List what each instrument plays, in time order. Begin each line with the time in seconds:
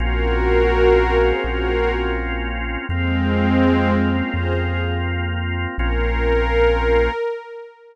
0.00 synth bass 2 A#1, drawbar organ A#3 C4 C#4 F4, pad 5 (bowed) F#4 A#4
1.20 pad 5 (bowed) G#4 C5
1.43 synth bass 2 A#1, pad 5 (bowed) F#4 A#4
2.89 synth bass 2 F2, pad 5 (bowed) G#3 C4, drawbar organ A#3 C4 F4
4.09 pad 5 (bowed) C#4 F4
4.33 synth bass 2 F2, pad 5 (bowed) G#4 C5
4.57 pad 5 (bowed) F4 G#4
5.78 synth bass 2 A#1, drawbar organ A#3 C4 C#4 F4, pad 5 (bowed) A#4